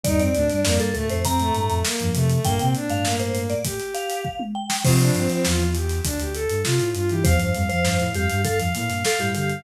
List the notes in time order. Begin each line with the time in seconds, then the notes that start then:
0.04 D#2 G2 G3 D#4 D5, kick, closed hi-hat
0.19 F2 C4 D5, closed hi-hat
0.34 D2 A2 A3 D4, closed hi-hat
0.49 G2 G3 D4, snare, closed hi-hat
0.64 F2 A#3 D5, snare
0.79 G2 A4, snare, closed hi-hat
0.94 D2 A2 A3 A4, closed hi-hat
1.09 F2 A2 A3 C5, snare, closed hi-hat
1.25 C4 A#5, kick, closed hi-hat
1.39 A2 A3, closed hi-hat
1.55 G2 A2 A3, closed hi-hat
1.69 F2, closed hi-hat
1.85 A#3, snare
2.00 F2 G2 F3, closed hi-hat
2.14 C3 A3, closed hi-hat
2.30 A3, closed hi-hat
2.44 G2 A#2 A#3 G5, kick, closed hi-hat
2.60 A#2 C3 A#3 C4, closed hi-hat
2.75 D4, closed hi-hat
2.89 G2 A2 A3 F5, closed hi-hat
3.05 A#3, snare
3.20 C5, closed hi-hat
3.35 closed hi-hat
3.50 D5, closed hi-hat
3.65 G4, kick, closed hi-hat
3.80 closed hi-hat
3.94 F5, closed hi-hat
4.10 closed hi-hat
4.25 kick
4.40 mid tom
4.55 G5
4.70 snare
4.84 C3 F3 C4 F4 C5, kick, crash
5.00 D4, snare, closed hi-hat
5.14 G2 C4, closed hi-hat
5.30 C4, closed hi-hat
5.45 E2 F4, snare
5.60 closed hi-hat
5.75 G4, closed hi-hat
5.90 snare, closed hi-hat
6.04 D2 D4, kick, closed hi-hat
6.20 D2 G4, closed hi-hat
6.34 A4, closed hi-hat
6.50 G2, closed hi-hat
6.64 C3 F4, snare
6.79 A2, snare, closed hi-hat
6.94 G2 F4, closed hi-hat
7.09 E3 E4 G4, closed hi-hat
7.24 E2 F2 F3 C5 F5, kick, closed hi-hat
7.39 G2 F5, closed hi-hat
7.54 F2 G2 G3 F5, closed hi-hat
7.69 F2 F3 C5 F5, closed hi-hat
7.85 G2 F5, snare
7.99 A2, snare, closed hi-hat
8.13 F2 G2 G3 G4 F5, closed hi-hat
8.30 G2 G3, closed hi-hat
8.44 A4 F5, kick, closed hi-hat
8.58 F2 F3 F5, snare, closed hi-hat
8.74 A2 A#2 A#3 F5, closed hi-hat
8.89 G2, snare, closed hi-hat
9.04 A4 F5, snare
9.18 G2 A2 G3 G4, closed hi-hat
9.35 D3 G4 F5, closed hi-hat
9.50 F5, closed hi-hat